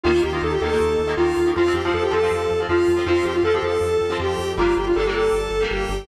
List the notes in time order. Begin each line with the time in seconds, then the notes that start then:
0.03 D#2 D#3 A#3 F4
0.14 D#3 A#3
0.22 D#2 G4
0.32 D#3 A#3 F4
0.42 D#2 A4
0.52 G4
0.61 D#2 D#3 A#3 A4
0.72 D#3 A#3
0.80 D#2
0.99 D#2
1.07 D#3 A#3
1.17 D#2 D#3 A#3 F4
1.37 D#2
1.46 D#3 A#3
1.56 F2 F3 C4 F4
1.66 F3 C4
1.74 F2 G4
1.85 F3 C4 F4
1.94 F2 A4
2.03 G4
2.11 F2 F3 C4 A4
2.23 F3 C4
2.31 F2
2.51 F2
2.60 F3 C4
2.69 F2 F3 C4 F4
2.88 F2
2.97 F3 C4
3.06 F2 F3 C4 F4
3.25 F2 G4
3.34 F4
3.43 F2 F3 C4 A4
3.54 F3 C4 G4
3.62 F2 A4
3.81 F2
4.01 F2
4.10 F3 C4
4.20 F2 G4
4.39 F2
4.57 G1 G3 A#3 D4 F4
4.77 G1 G4
4.87 F4
4.96 G1 G3 A#3 D4 A4
5.05 G3 A#3 G4
5.09 D4
5.14 G1 A4
5.32 G1
5.50 G1
5.61 G3 A#3 D4
5.70 G1 G4
5.89 G1